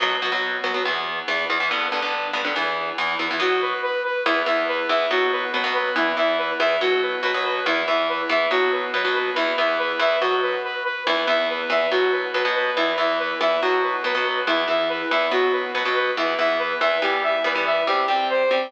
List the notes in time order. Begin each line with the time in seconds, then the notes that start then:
0.00 B2 F#3 B3
0.22 B2 F#3 B3
0.32 B2 F#3 B3
0.64 B2 F#3 B3
0.74 B2 F#3 B3
0.85 E2 E3 B3
1.28 E2 E3 B3
1.50 E2 E3 B3
1.60 E2 E3 B3
1.71 G2 D3 B3
1.92 G2 D3 B3
2.02 G2 D3 B3
2.33 G2 D3 B3
2.45 G2 D3 B3
2.56 E2 E3 B3
2.98 E2 E3 B3
3.19 E2 E3 B3
3.31 E2 E3 B3
3.40 B2 F#3 B3 F#4
3.62 B4
3.83 B4
4.04 B4
4.26 E2 E3 B3 E4
4.46 E2 E3 B3 E5
4.68 B4
4.89 E2 E3 B3 E5
5.11 B2 F#3 B3 F#4
5.32 B4
5.53 B2 F#3 B3 B4
5.64 B2 F#3 B3
5.75 B4
5.96 E2 E3 B3 E4
6.17 E2 E3 B3 E5
6.38 B4
6.59 E2 E3 B3 E5
6.81 B2 F#3 B3 F#4
7.02 B4
7.23 B2 F#3 B3 B4
7.34 B2 F#3 B3
7.45 B4
7.66 E2 E3 B3 E4
7.87 E2 E3 B3 E5
8.09 B4
8.29 E2 E3 B3 E5
8.51 B2 F#3 B3 F#4
8.72 B4
8.94 B2 F#3 B3 B4
9.05 B2 F#3 B3
9.15 B4
9.36 E2 E3 B3 E4
9.58 E2 E3 B3 E5
9.79 B4
9.99 E2 E3 B3 E5
10.21 B2 F#3 B3 F#4
10.42 B4
10.64 B4
10.84 B4
11.06 E2 E3 B3 E4
11.27 E2 E3 B3 E5
11.50 B4
11.70 E2 E3 B3 E5
11.91 B2 F#3 B3 F#4
12.12 B4
12.34 B2 F#3 B3 B4
12.45 B2 F#3 B3
12.55 B4
12.77 E2 E3 B3 E4
12.98 E2 E3 B3 E5
13.19 B4
13.41 E2 E3 B3 E5
13.62 B2 F#3 B3 F#4
13.83 B4
14.04 B2 F#3 B3 B4
14.15 B2 F#3 B3
14.25 B4
14.47 E2 E3 B3 E4
14.68 E2 E3 B3 E5
14.89 B4
15.11 E2 E3 B3 E5
15.31 B2 F#3 B3 F#4
15.52 B4
15.74 B2 F#3 B3 B4
15.85 B2 F#3 B3
15.96 B4
16.17 E2 E3 B3 E4
16.38 E2 E3 B3 E5
16.59 B4
16.80 E2 E3 B3 E5
17.02 E3 G3 B3 G4
17.23 E5
17.44 E3 G3 B3 B4
17.55 E3 G3 B3
17.66 E5
17.87 C3 G3 C4 G4
18.08 C3 G3 C4 G5
18.30 C5
18.51 C3 G3 C4 G5